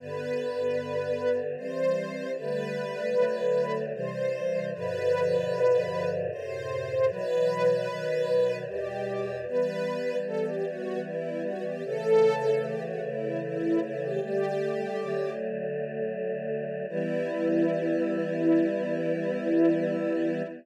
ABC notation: X:1
M:3/4
L:1/16
Q:1/4=76
K:G
V:1 name="String Ensemble 1"
B8 c4 | B8 c4 | B8 c4 | B8 G4 |
[K:Em] B4 A G F2 E2 F G | A4 G F E2 E2 E G | "^rit." G6 z6 | E12 |]
V:2 name="Choir Aahs"
[G,,D,B,]8 [E,G,C]4 | [D,G,A,]4 [D,F,A,]4 [C,E,G,]4 | [G,,B,,D,=F,]8 [^F,,A,,C,]4 | [B,,E,F,]4 [B,,^D,F,]4 [E,,B,,G,]4 |
[K:Em] [E,G,B,]12 | [^C,E,A,]12 | "^rit." [D,G,A,]4 [D,F,A,]8 | [E,G,B,]12 |]